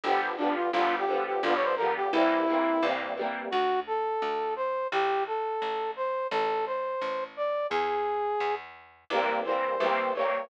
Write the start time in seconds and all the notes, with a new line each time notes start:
0.04 G1 D3 F3 G3 G4
0.09 B3
0.38 D3 F3 D4
0.42 G3 B3
0.55 F4
0.72 G1 D3 F3 F4
0.77 G3 B3
0.99 G4
1.08 D3 F3 G3
1.14 B3
1.26 G4
1.43 G1 D3 F3 G3 F4
1.49 B3
1.55 C#5
1.65 C5
1.77 D3 F3 A#4
1.82 G3 B3
1.96 G4
2.13 C2 E3 G3 A#3 E4
2.18 C4
2.48 E3 G3 A#3
2.53 C4
2.82 C2 E3 G3 A#3
2.88 C4
3.17 E3 G3 A#3
3.23 C4
3.51 D2 F#4
3.87 A4
4.22 D2
4.56 C5
4.92 A1 G4
5.27 A4
5.62 A1
5.96 C5
6.31 A1 A4
6.66 C5
7.01 A1
7.37 D5
7.70 E2 G#4
8.40 E2
9.10 C2 E3 G3 A#4
9.14 A#3 C4
9.45 E3 G3 A#3 C5
9.51 C4
9.80 C2 E3 G3 A#3
9.86 C4
10.15 E3 G3 A#3 C#5
10.21 C4